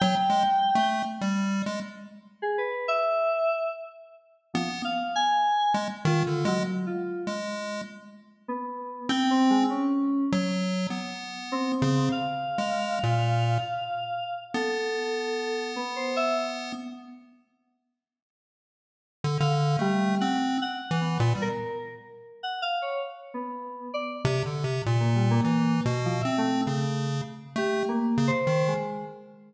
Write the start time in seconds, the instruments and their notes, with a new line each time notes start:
0.00 lead 1 (square) F#3, electric piano 2 G5
0.30 lead 1 (square) G#3
0.75 lead 1 (square) A3
1.21 lead 1 (square) G3
1.66 lead 1 (square) G#3
2.42 electric piano 2 G#4
2.58 electric piano 2 B4
2.88 electric piano 2 E5
4.54 electric piano 2 F3, lead 1 (square) B3
4.84 electric piano 2 F5
5.16 electric piano 2 G#5
5.74 lead 1 (square) G#3
6.05 lead 1 (square) D#3, electric piano 2 F4
6.27 lead 1 (square) D3
6.45 electric piano 2 F#3, lead 1 (square) G#3
6.86 electric piano 2 F4
7.27 lead 1 (square) G#3
8.48 electric piano 2 B3
9.09 lead 1 (square) C4, electric piano 2 G5
9.31 electric piano 2 C4
9.50 electric piano 2 G#3
9.70 electric piano 2 C#4
10.32 lead 1 (square) F#3
10.90 lead 1 (square) B3
11.52 electric piano 2 C4
11.82 lead 1 (square) C#3
12.12 electric piano 2 F5
12.58 lead 1 (square) G#3
13.03 lead 1 (square) A#2
14.54 lead 1 (square) B3, electric piano 2 A4
15.76 electric piano 2 B3
15.96 electric piano 2 C5
16.16 electric piano 2 E5
19.24 lead 1 (square) D3
19.40 lead 1 (square) D3, electric piano 2 F5
19.79 electric piano 2 G3, lead 1 (square) A3
20.20 lead 1 (square) C4, electric piano 2 F#5
20.61 electric piano 2 F#5
20.91 lead 1 (square) E3
21.01 electric piano 2 B3
21.20 lead 1 (square) A#2
21.35 lead 1 (square) G3
21.42 electric piano 2 A#4
22.43 electric piano 2 F#5
22.62 electric piano 2 F5
22.82 electric piano 2 C#5
23.34 electric piano 2 B3
23.94 electric piano 2 D5
24.25 lead 1 (square) C3
24.46 lead 1 (square) D3
24.64 lead 1 (square) C3
24.86 lead 1 (square) A#2
25.00 electric piano 2 A#3
25.15 electric piano 2 G3
25.31 electric piano 2 A#3
25.44 lead 1 (square) E3
25.85 lead 1 (square) B2
26.05 electric piano 2 F3
26.21 lead 1 (square) C4, electric piano 2 E5
26.38 electric piano 2 A3
26.66 lead 1 (square) C#3, electric piano 2 A3
27.56 lead 1 (square) A3, electric piano 2 G4
27.89 electric piano 2 A#3
28.18 lead 1 (square) C#3
28.27 electric piano 2 C5
28.47 lead 1 (square) D#3
28.68 electric piano 2 G#3